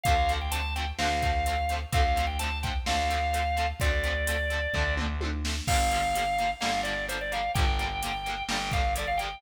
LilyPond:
<<
  \new Staff \with { instrumentName = "Drawbar Organ" } { \time 4/4 \key d \dorian \tempo 4 = 128 f''8. g''16 a''8 g''16 r16 f''2 | f''8. g''16 a''8 g''16 r16 f''2 | d''2~ d''8 r4. | f''2 f''8 d''8 c''16 d''16 f''8 |
g''2 g''8 f''8 d''16 f''16 g''8 | }
  \new Staff \with { instrumentName = "Overdriven Guitar" } { \time 4/4 \key d \dorian <d f a c'>8 <d f a c'>8 <d f a c'>8 <d f a c'>8 <d f a c'>8 <d f a c'>8 <d f a c'>8 <d f a c'>8 | <d f a c'>8 <d f a c'>8 <d f a c'>8 <d f a c'>8 <d f a c'>8 <d f a c'>8 <d f a c'>8 <d f a c'>8 | <d f a c'>8 <d f a c'>8 <d f a c'>8 <d f a c'>8 <d f a c'>8 <d f a c'>8 <d f a c'>8 <d f a c'>8 | <d f g bes>8 <d f g bes>8 <d f g bes>8 <d f g bes>8 <d f g bes>8 <d f g bes>8 <d f g bes>8 <d f g bes>8 |
<d f g bes>8 <d f g bes>8 <d f g bes>8 <d f g bes>8 <d f g bes>8 <d f g bes>8 <d f g bes>8 <d f g bes>8 | }
  \new Staff \with { instrumentName = "Electric Bass (finger)" } { \clef bass \time 4/4 \key d \dorian d,2 d,2 | d,2 d,2 | d,2 d,2 | g,,2 g,,2 |
g,,2 g,,2 | }
  \new DrumStaff \with { instrumentName = "Drums" } \drummode { \time 4/4 <hh bd>8 hh8 hh8 hh8 sn8 <hh bd>8 hh8 hh8 | <hh bd>8 hh8 hh8 <hh bd>8 sn8 hh8 hh8 hh8 | <hh bd>8 hh8 hh8 hh8 <bd tomfh>8 toml8 tommh8 sn8 | <cymc bd>8 hh8 hh8 hh8 sn8 hh8 hh8 hh8 |
<hh bd>8 hh8 hh8 hh8 sn8 <hh bd>8 hh8 hh8 | }
>>